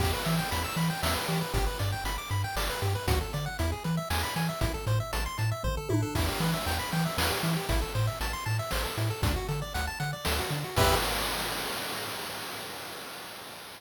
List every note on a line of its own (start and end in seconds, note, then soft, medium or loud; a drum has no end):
0.00 0.14 E2 loud
0.00 0.11 G4 medium
0.00 kick medium
0.00 crash medium
0.13 0.24 B4 medium
0.25 0.40 E3 medium
0.25 0.37 E5 medium
0.25 closed hi-hat medium
0.39 0.50 G5 medium
0.51 0.66 E2 medium
0.51 0.63 B5 medium
0.51 closed hi-hat medium
0.64 0.76 E6 medium
0.76 0.91 E3 medium
0.76 0.89 B5 medium
0.76 closed hi-hat medium
0.90 1.01 G5 medium
1.03 1.17 E2 medium
1.03 1.14 E5 medium
1.03 snare loud
1.15 1.27 B4 medium
1.28 1.43 E3 medium
1.28 1.40 G4 medium
1.28 closed hi-hat medium
1.41 1.53 B4 medium
1.53 1.68 G1 medium
1.53 1.65 G4 medium
1.53 kick medium
1.53 closed hi-hat medium
1.67 1.78 B4 medium
1.79 1.94 G2 medium
1.79 1.91 D5 medium
1.79 closed hi-hat medium
1.92 2.04 G5 medium
2.04 2.18 G1 medium
2.04 2.17 B5 medium
2.04 closed hi-hat medium
2.18 2.29 D6 medium
2.30 2.45 G2 medium
2.30 2.42 B5 medium
2.30 closed hi-hat medium
2.44 2.56 G5 medium
2.56 2.70 G1 medium
2.56 2.68 D5 medium
2.56 snare medium
2.70 2.81 B4 medium
2.82 2.96 G2 medium
2.82 2.94 G4 medium
2.82 closed hi-hat medium
2.95 3.07 B4 medium
3.07 3.22 D2 medium
3.07 3.19 F#4 medium
3.07 kick loud
3.07 closed hi-hat loud
3.21 3.32 A4 medium
3.33 3.48 D3 medium
3.33 3.45 D5 medium
3.33 closed hi-hat medium
3.46 3.57 F#5 medium
3.59 3.74 E2 loud
3.59 3.71 E4 medium
3.59 closed hi-hat medium
3.72 3.83 G#4 medium
3.84 3.99 E3 medium
3.84 3.96 B4 medium
3.84 closed hi-hat medium
3.97 4.09 E5 medium
4.10 4.25 E2 medium
4.10 4.22 G#5 medium
4.10 snare medium
4.23 4.35 B5 medium
4.36 4.50 E3 medium
4.36 4.48 G#5 medium
4.36 closed hi-hat medium
4.49 4.60 E5 medium
4.61 4.76 A1 medium
4.61 4.73 E4 medium
4.61 kick medium
4.61 closed hi-hat medium
4.74 4.85 A4 medium
4.87 5.01 A2 medium
4.87 4.99 C5 medium
4.87 closed hi-hat medium
5.00 5.12 E5 medium
5.13 5.28 A1 medium
5.13 5.24 A5 medium
5.13 closed hi-hat medium
5.26 5.37 C6 medium
5.38 5.53 A2 medium
5.38 5.50 A5 medium
5.38 closed hi-hat medium
5.51 5.63 E5 medium
5.63 5.78 A1 medium
5.63 5.76 C5 medium
5.63 kick medium
5.63 floor tom medium
5.77 5.89 A4 medium
5.89 6.04 A2 medium
5.89 6.01 E4 medium
5.89 high tom medium
6.02 6.14 A4 medium
6.15 6.30 E2 medium
6.15 6.27 E4 medium
6.15 kick medium
6.15 crash medium
6.28 6.40 G4 soft
6.40 6.54 E3 medium
6.40 6.52 B4 medium
6.40 closed hi-hat medium
6.54 6.65 E5 medium
6.66 6.81 E2 medium
6.66 6.78 G5 medium
6.66 closed hi-hat medium
6.79 6.91 B5 medium
6.92 7.07 E3 medium
6.92 7.04 G5 medium
6.92 closed hi-hat medium
7.05 7.17 E5 medium
7.18 7.32 E2 medium
7.18 7.29 B4 medium
7.18 snare loud
7.30 7.42 G4 medium
7.43 7.57 E3 medium
7.43 7.55 E4 medium
7.43 closed hi-hat medium
7.57 7.68 G4 medium
7.69 7.84 A1 loud
7.69 7.81 E4 medium
7.69 kick medium
7.69 closed hi-hat medium
7.82 7.93 A4 medium
7.95 8.09 A2 medium
7.95 8.06 C5 medium
7.95 closed hi-hat medium
8.07 8.19 E5 medium
8.21 8.35 A1 medium
8.21 8.32 A5 medium
8.21 closed hi-hat medium
8.33 8.45 C6 medium
8.46 8.60 A2 medium
8.46 8.57 A5 medium
8.46 closed hi-hat medium
8.59 8.71 E5 medium
8.71 8.86 A1 medium
8.71 8.83 C5 medium
8.71 snare medium
8.85 8.96 A4 medium
8.98 9.12 A2 medium
8.98 9.09 E4 medium
8.98 closed hi-hat medium
9.10 9.22 A4 medium
9.22 9.37 D2 medium
9.22 9.34 D4 medium
9.22 kick loud
9.22 closed hi-hat loud
9.36 9.47 F#4 medium
9.49 9.63 D3 medium
9.49 9.60 A4 medium
9.49 closed hi-hat medium
9.62 9.73 D5 medium
9.74 9.89 D2 medium
9.74 9.86 F#5 medium
9.74 closed hi-hat medium
9.87 9.99 A5 medium
10.00 10.14 D3 medium
10.00 10.11 F#5 medium
10.00 closed hi-hat medium
10.13 10.24 D5 medium
10.25 10.41 D2 medium
10.25 10.37 A4 medium
10.25 snare loud
10.39 10.50 F#4 medium
10.51 10.65 D3 medium
10.51 10.63 D4 medium
10.51 closed hi-hat medium
10.64 10.76 F#4 soft
10.76 10.95 E2 medium
10.76 10.95 G4 loud
10.76 10.95 B4 loud
10.76 10.95 E5 medium
10.76 kick loud
10.76 crash loud